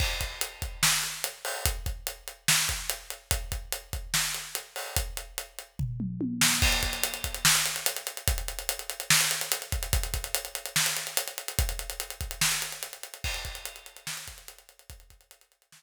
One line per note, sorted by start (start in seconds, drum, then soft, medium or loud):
0.00 kick loud
0.00 crash medium
0.21 kick medium
0.21 closed hi-hat medium
0.41 closed hi-hat loud
0.62 kick medium
0.62 closed hi-hat medium
0.83 snare loud
1.03 closed hi-hat medium
1.24 closed hi-hat loud
1.45 open hi-hat medium
1.66 kick loud
1.66 closed hi-hat loud
1.86 kick medium
1.86 closed hi-hat medium
2.07 closed hi-hat medium
2.28 closed hi-hat medium
2.48 snare loud
2.69 kick medium
2.69 closed hi-hat medium
2.90 closed hi-hat loud
3.10 closed hi-hat medium
3.31 kick loud
3.31 closed hi-hat loud
3.52 kick medium
3.52 closed hi-hat medium
3.72 closed hi-hat loud
3.93 kick medium
3.93 closed hi-hat medium
4.14 snare loud
4.34 closed hi-hat medium
4.55 closed hi-hat medium
4.76 open hi-hat medium
4.96 kick loud
4.96 closed hi-hat loud
5.17 closed hi-hat medium
5.38 closed hi-hat medium
5.59 closed hi-hat medium
5.79 kick medium
5.79 floor tom medium
6.00 mid tom medium
6.21 high tom medium
6.41 snare loud
6.62 kick loud
6.62 crash loud
6.72 closed hi-hat medium
6.83 kick medium
6.83 closed hi-hat medium
6.93 closed hi-hat medium
7.04 closed hi-hat loud
7.14 closed hi-hat medium
7.24 kick medium
7.24 closed hi-hat medium
7.34 closed hi-hat medium
7.45 snare loud
7.55 closed hi-hat medium
7.66 closed hi-hat medium
7.76 closed hi-hat medium
7.86 closed hi-hat loud
7.97 closed hi-hat medium
8.07 closed hi-hat medium
8.17 closed hi-hat medium
8.28 kick loud
8.28 closed hi-hat loud
8.38 closed hi-hat medium
8.48 closed hi-hat medium
8.59 closed hi-hat medium
8.69 closed hi-hat loud
8.79 closed hi-hat medium
8.90 closed hi-hat medium
9.00 closed hi-hat medium
9.10 snare loud
9.21 closed hi-hat medium
9.31 closed hi-hat medium
9.41 closed hi-hat medium
9.52 closed hi-hat loud
9.62 closed hi-hat medium
9.72 kick loud
9.72 closed hi-hat medium
9.83 closed hi-hat medium
9.93 kick loud
9.93 closed hi-hat loud
10.03 closed hi-hat medium
10.14 kick medium
10.14 closed hi-hat medium
10.24 closed hi-hat medium
10.35 closed hi-hat loud
10.45 closed hi-hat medium
10.55 closed hi-hat medium
10.66 closed hi-hat medium
10.76 snare loud
10.86 closed hi-hat medium
10.97 closed hi-hat medium
11.07 closed hi-hat medium
11.17 closed hi-hat loud
11.28 closed hi-hat medium
11.38 closed hi-hat medium
11.48 closed hi-hat medium
11.59 kick loud
11.59 closed hi-hat loud
11.69 closed hi-hat medium
11.79 closed hi-hat medium
11.90 closed hi-hat medium
12.00 closed hi-hat medium
12.10 closed hi-hat medium
12.21 kick medium
12.21 closed hi-hat medium
12.31 closed hi-hat medium
12.41 snare loud
12.52 closed hi-hat medium
12.62 closed hi-hat medium
12.72 closed hi-hat medium
12.83 closed hi-hat loud
12.93 closed hi-hat medium
13.03 closed hi-hat medium
13.14 closed hi-hat medium
13.24 kick loud
13.24 crash loud
13.34 closed hi-hat medium
13.45 kick medium
13.45 closed hi-hat medium
13.55 closed hi-hat medium
13.65 closed hi-hat loud
13.76 closed hi-hat medium
13.86 closed hi-hat medium
13.97 closed hi-hat medium
14.07 snare loud
14.17 closed hi-hat medium
14.28 kick medium
14.28 closed hi-hat medium
14.38 closed hi-hat medium
14.48 closed hi-hat loud
14.59 closed hi-hat medium
14.69 closed hi-hat medium
14.79 closed hi-hat medium
14.90 kick loud
14.90 closed hi-hat loud
15.00 closed hi-hat medium
15.10 kick medium
15.10 closed hi-hat medium
15.21 closed hi-hat medium
15.31 closed hi-hat loud
15.41 closed hi-hat medium
15.52 closed hi-hat medium
15.62 closed hi-hat medium
15.72 snare loud